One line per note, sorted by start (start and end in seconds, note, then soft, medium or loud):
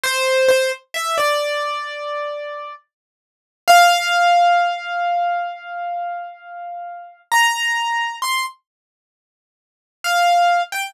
0.04 0.48 C5 loud
0.48 0.70 C5 medium
0.94 1.16 E5 medium
1.18 2.73 D5 medium
3.68 7.20 F5 loud
7.32 8.16 A#5 medium
8.22 8.44 C6 medium
10.04 10.61 F5 medium
10.72 10.94 G5 medium